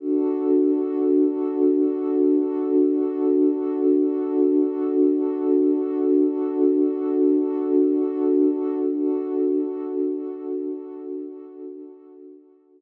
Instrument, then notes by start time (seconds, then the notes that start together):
pad 2 (warm)
0.00 D4 F#4 A4
8.89 D4 F#4 A4